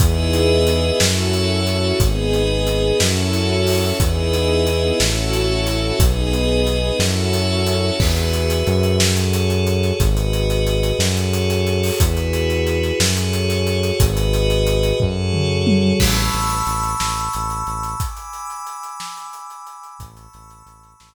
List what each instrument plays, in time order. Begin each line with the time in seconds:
0.00 synth bass 1 E2, string ensemble 1 B3 D#4 E4 G#4, pad 5 (bowed) G#4 B4 D#5 E5, kick, closed hi-hat
0.33 closed hi-hat
0.67 closed hi-hat
1.00 synth bass 1 F#2, string ensemble 1 C#4 E4 F#4 A4, pad 5 (bowed) F#4 A4 C#5 E5, snare
1.33 closed hi-hat
1.67 closed hi-hat
2.00 synth bass 1 G#1, string ensemble 1 B3 D#4 G#4, pad 5 (bowed) G#4 B4 D#5, kick, closed hi-hat
2.33 closed hi-hat
2.67 closed hi-hat
3.00 synth bass 1 F#2, string ensemble 1 C#4 E4 F#4 A4, pad 5 (bowed) F#4 A4 C#5 E5, snare
3.33 closed hi-hat
3.67 open hi-hat
4.00 synth bass 1 E2, string ensemble 1 B3 D#4 E4 G#4, pad 5 (bowed) G#4 B4 D#5 E5, kick, closed hi-hat
4.33 closed hi-hat
4.67 closed hi-hat
5.00 synth bass 1 A1, string ensemble 1 C#4 E4 F#4 A4, pad 5 (bowed) F#4 A4 C#5 E5, snare
5.33 closed hi-hat
5.67 closed hi-hat
5.99 synth bass 1 B1, string ensemble 1 B3 D#4 G#4, pad 5 (bowed) G#4 B4 D#5, kick, closed hi-hat
6.33 closed hi-hat
6.67 closed hi-hat
6.99 synth bass 1 F#2, string ensemble 1 C#4 E4 F#4 A4, pad 5 (bowed) F#4 A4 C#5 E5, snare
7.33 closed hi-hat
7.67 closed hi-hat
8.00 synth bass 1 E2, pad 5 (bowed) F#4 G#4 B4 E5, kick, crash
8.17 closed hi-hat
8.33 closed hi-hat
8.50 closed hi-hat
8.67 synth bass 1 F#2, closed hi-hat
8.83 closed hi-hat
9.00 pad 5 (bowed) F#4 G#4 A4 C#5, snare
9.17 closed hi-hat
9.33 closed hi-hat
9.50 closed hi-hat
9.67 closed hi-hat
9.83 closed hi-hat
10.00 synth bass 1 G#1, pad 5 (bowed) F#4 G#4 B4 D#5, kick, closed hi-hat
10.17 closed hi-hat
10.33 closed hi-hat
10.50 closed hi-hat
10.67 closed hi-hat
10.83 closed hi-hat
10.99 synth bass 1 F#2, pad 5 (bowed) F#4 G#4 A4 C#5, snare
11.17 closed hi-hat
11.33 closed hi-hat
11.50 closed hi-hat
11.67 closed hi-hat
11.83 open hi-hat
12.00 synth bass 1 E2, pad 5 (bowed) E4 F#4 G#4 B4, kick, closed hi-hat
12.17 closed hi-hat
12.33 closed hi-hat
12.50 closed hi-hat
12.67 closed hi-hat
12.83 closed hi-hat
13.00 synth bass 1 F#2, pad 5 (bowed) F#4 G#4 A4 C#5, snare
13.17 closed hi-hat
13.33 closed hi-hat
13.50 closed hi-hat
13.67 closed hi-hat
13.83 closed hi-hat
14.00 synth bass 1 G#1, pad 5 (bowed) F#4 G#4 B4 D#5, kick, closed hi-hat
14.17 closed hi-hat
14.33 closed hi-hat
14.50 closed hi-hat
14.67 closed hi-hat
14.83 closed hi-hat
15.00 synth bass 1 F#2, pad 5 (bowed) F#4 G#4 A4 C#5, kick, floor tom
15.33 mid tom
15.67 high tom
16.00 synth bass 1 A1, pad 5 (bowed) A5 B5 C#6 E6, kick, crash
16.33 synth bass 1 A1, closed hi-hat
16.50 closed hi-hat
16.66 synth bass 1 A1, closed hi-hat
16.83 closed hi-hat
17.00 synth bass 1 A1, snare
17.17 closed hi-hat
17.33 synth bass 1 A1, closed hi-hat
17.50 closed hi-hat
17.67 synth bass 1 A1, closed hi-hat
17.83 closed hi-hat
18.00 pad 5 (bowed) G#5 B5 D6 E6, kick, closed hi-hat
18.17 closed hi-hat
18.33 closed hi-hat
18.50 closed hi-hat
18.67 closed hi-hat
18.83 closed hi-hat
19.00 snare
19.17 closed hi-hat
19.33 closed hi-hat
19.50 closed hi-hat
19.67 closed hi-hat
19.83 closed hi-hat
19.99 synth bass 1 A1, pad 5 (bowed) A5 B5 C#6 E6, kick, closed hi-hat
20.17 closed hi-hat
20.33 synth bass 1 A1, closed hi-hat
20.50 closed hi-hat
20.66 synth bass 1 A1, closed hi-hat
20.83 closed hi-hat
21.00 synth bass 1 A1, snare